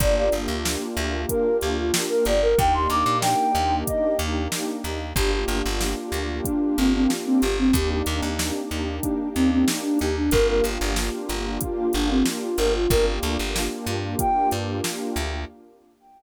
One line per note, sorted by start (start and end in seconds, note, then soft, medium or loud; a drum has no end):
0.00 0.29 G1 loud
0.00 2.32 A#3 loud
0.00 2.32 D4 medium
0.00 2.32 F4 medium
0.00 2.32 G4 medium
0.00 0.15 D5 medium
0.00 kick loud
0.00 closed hi-hat loud
0.17 0.32 D5 medium
0.32 0.47 G1 medium
0.32 closed hi-hat medium
0.48 0.77 D2 medium
0.65 snare loud
0.97 1.26 D2 loud
0.97 closed hi-hat medium
1.29 1.57 A#4 medium
1.29 kick medium
1.29 closed hi-hat loud
1.61 1.91 D2 medium
1.61 1.77 G4 medium
1.61 closed hi-hat medium
1.78 1.93 F4 medium
1.94 snare loud
2.09 2.25 A#4 medium
2.25 2.55 G1 medium
2.25 2.42 D5 medium
2.25 closed hi-hat medium
2.42 2.58 A#4 medium
2.58 2.87 D#2 loud
2.58 4.90 A#3 medium
2.58 4.90 D4 medium
2.58 4.90 D#4 medium
2.58 4.90 G4 medium
2.58 2.74 G5 medium
2.58 kick loud
2.58 closed hi-hat loud
2.74 2.89 C6 medium
2.90 3.04 D#2 loud
2.90 3.18 D6 medium
2.90 closed hi-hat medium
3.06 3.35 A#2 loud
3.22 3.75 G5 medium
3.22 snare loud
3.55 3.84 D#2 loud
3.55 closed hi-hat medium
3.87 4.17 D#5 medium
3.87 kick medium
3.87 closed hi-hat loud
4.19 4.48 D#2 loud
4.19 closed hi-hat medium
4.52 snare loud
4.84 5.13 D#2 medium
4.84 snare soft
4.84 closed hi-hat medium
5.16 5.45 G1 loud
5.16 7.48 A#3 medium
5.16 7.48 D4 medium
5.16 7.48 F4 medium
5.16 5.31 G4 medium
5.16 7.48 G4 medium
5.16 kick loud
5.16 closed hi-hat loud
5.32 5.47 G4 medium
5.48 5.62 G1 medium
5.48 closed hi-hat medium
5.66 5.95 G1 loud
5.81 snare medium
6.12 6.41 D2 medium
6.12 closed hi-hat medium
6.44 6.76 D4 medium
6.44 kick medium
6.44 closed hi-hat loud
6.77 7.07 G1 medium
6.77 6.92 C4 medium
6.77 closed hi-hat medium
6.95 7.10 C4 medium
7.10 snare medium
7.26 7.41 C4 medium
7.42 7.72 G1 loud
7.42 7.57 G4 medium
7.42 closed hi-hat medium
7.58 7.74 C4 medium
7.73 8.02 D#2 loud
7.73 10.07 A#3 medium
7.73 10.07 D4 medium
7.73 10.07 D#4 medium
7.73 7.90 G4 medium
7.73 10.07 G4 medium
7.73 kick loud
7.73 closed hi-hat loud
7.90 8.06 G4 medium
8.06 8.21 D#2 loud
8.06 closed hi-hat medium
8.22 8.51 D#2 medium
8.39 snare loud
8.71 9.00 D#2 medium
8.71 closed hi-hat medium
9.03 9.29 D4 medium
9.03 kick medium
9.03 closed hi-hat loud
9.35 9.65 D#2 medium
9.35 9.50 C4 medium
9.35 closed hi-hat medium
9.51 9.67 C4 medium
9.68 snare loud
9.83 9.98 D4 medium
9.99 10.30 D#2 medium
9.99 10.16 G4 medium
9.99 closed hi-hat medium
10.17 10.32 D4 medium
10.31 10.61 G1 loud
10.31 12.64 A#3 medium
10.31 12.64 D4 medium
10.31 12.64 F4 loud
10.31 12.64 G4 medium
10.31 10.47 A#4 loud
10.31 kick loud
10.31 closed hi-hat loud
10.48 10.64 A#4 medium
10.64 10.78 G1 medium
10.64 closed hi-hat medium
10.81 11.10 G1 loud
10.96 snare loud
11.29 11.58 G1 medium
11.29 snare soft
11.29 closed hi-hat medium
11.61 11.90 F4 medium
11.61 kick medium
11.61 closed hi-hat loud
11.93 12.23 G1 loud
11.93 12.09 D4 medium
11.93 closed hi-hat medium
12.10 12.25 C4 medium
12.26 snare loud
12.41 12.57 F4 medium
12.58 12.87 G1 loud
12.58 12.73 A#4 medium
12.58 closed hi-hat medium
12.74 12.90 F4 medium
12.90 13.19 G1 loud
12.90 15.23 A#3 loud
12.90 15.23 D4 medium
12.90 15.23 F4 medium
12.90 15.23 G4 medium
12.90 13.06 A#4 medium
12.90 kick loud
12.90 closed hi-hat loud
13.22 13.37 D2 loud
13.22 snare soft
13.22 closed hi-hat medium
13.39 13.68 G1 loud
13.56 snare loud
13.86 14.15 G2 medium
13.86 closed hi-hat medium
14.19 14.49 G5 medium
14.19 kick medium
14.19 closed hi-hat loud
14.51 14.81 G2 loud
14.51 closed hi-hat medium
14.84 snare loud
15.16 15.45 D2 loud
15.16 closed hi-hat medium